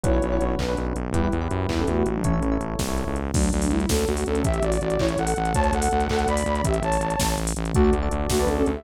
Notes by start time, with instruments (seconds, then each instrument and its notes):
0.03 synth bass 1 B1, electric piano 1 C#4 D4 F#4 B4, ocarina E4 C#5, kick, closed hi-hat
0.13 electric piano 1 C#4 D4 F#4 B4
0.22 synth bass 1 B1, closed hi-hat
0.32 electric piano 1 C#4 D4 F#4 B4
0.40 synth bass 1 B1, closed hi-hat
0.59 synth bass 1 B1, ocarina D4 B4, kick, clap
0.69 electric piano 1 C#4 D4 F#4 B4
0.77 synth bass 1 B1, closed hi-hat
0.95 synth bass 1 B1, closed hi-hat
1.13 synth bass 1 E2, ocarina G3 E4, electric piano 1 E4 G4 B4, kick, closed hi-hat
1.24 electric piano 1 E4 G4 B4
1.32 synth bass 1 E2, closed hi-hat
1.41 electric piano 1 E4 G4 B4
1.51 synth bass 1 F#2, closed hi-hat
1.69 synth bass 1 E2, ocarina G3 E4, kick, clap
1.78 ocarina C#4 A4, electric piano 1 E4 G4 B4
1.87 synth bass 1 E2, ocarina A3 F#4, closed hi-hat
1.97 ocarina A3 F#4
2.06 synth bass 1 A1, ocarina A3 F#4, closed hi-hat
2.15 ocarina F#3 D4
2.24 ocarina E3 C#4, electric piano 1 E4 A4 C#5, kick, closed hi-hat
2.33 electric piano 1 E4 A4 C#5
2.42 synth bass 1 A1, closed hi-hat
2.52 electric piano 1 E4 A4 C#5
2.60 synth bass 1 A1, closed hi-hat
2.79 synth bass 1 C2, kick, snare
2.88 electric piano 1 E4 A4 C#5
2.97 closed hi-hat
3.07 synth bass 1 C#2
3.16 closed hi-hat
3.34 synth bass 1 D2, ocarina F#3 D4, kick, crash
3.43 closed hi-hat
3.52 synth bass 1 D2, ocarina F#3 D4, closed hi-hat
3.62 ocarina F#3 D4, open hi-hat
3.70 synth bass 1 D2, ocarina G3 E4, closed hi-hat
3.80 closed hi-hat
3.89 synth bass 1 D2, ocarina C#4 A4, kick, snare
3.98 closed hi-hat
4.07 synth bass 1 D2, ocarina A3 F#4, closed hi-hat
4.17 open hi-hat
4.26 synth bass 1 D2, ocarina C#4 A4, closed hi-hat
4.35 closed hi-hat
4.44 synth bass 1 A1, ocarina G4 E5, kick, closed hi-hat
4.54 closed hi-hat
4.62 synth bass 1 A1, ocarina F#4 D5, closed hi-hat
4.72 ocarina F#4 D5, open hi-hat
4.81 synth bass 1 A1, ocarina F#4 D5, closed hi-hat
4.90 closed hi-hat
4.99 synth bass 1 A1, ocarina E4 C#5, kick, clap
5.08 closed hi-hat
5.18 synth bass 1 A1, ocarina A4 F#5, closed hi-hat
5.27 open hi-hat
5.36 synth bass 1 A1, closed hi-hat
5.45 closed hi-hat
5.54 synth bass 1 D2, ocarina C#5 A5, kick, closed hi-hat
5.64 closed hi-hat
5.72 synth bass 1 D2, ocarina A4 F#5, closed hi-hat
5.82 ocarina A4 F#5, open hi-hat
5.91 synth bass 1 D2, ocarina A4 F#5, closed hi-hat
6.00 closed hi-hat
6.09 synth bass 1 D2, ocarina A4 F#5, kick, clap
6.19 closed hi-hat
6.27 synth bass 1 D2, ocarina D5 B5, closed hi-hat
6.37 open hi-hat
6.46 synth bass 1 D2, closed hi-hat
6.55 closed hi-hat
6.64 synth bass 1 A1, ocarina G4 E5, kick, closed hi-hat
6.74 closed hi-hat
6.82 synth bass 1 A1, ocarina C#5 A5, closed hi-hat
6.92 open hi-hat
7.00 synth bass 1 A1, closed hi-hat
7.10 closed hi-hat
7.19 synth bass 1 A1, kick, snare
7.29 closed hi-hat
7.37 synth bass 1 A1, closed hi-hat
7.47 open hi-hat
7.56 synth bass 1 A1, closed hi-hat
7.65 closed hi-hat
7.74 synth bass 1 D2, ocarina A3 F#4, electric piano 1 F#4 A4 D5, kick, closed hi-hat
7.84 electric piano 1 F#4 A4 D5
7.93 synth bass 1 D2, closed hi-hat
8.02 electric piano 1 F#4 A4 D5
8.11 synth bass 1 D2, closed hi-hat
8.30 synth bass 1 D2, ocarina A3 F#4, kick, snare
8.39 ocarina D4 B4, electric piano 1 F#4 A4 D5
8.47 synth bass 1 D2, ocarina C#4 A4, closed hi-hat
8.57 ocarina C#4 A4
8.66 synth bass 1 D2, ocarina C#4 A4, closed hi-hat
8.75 ocarina G4 E5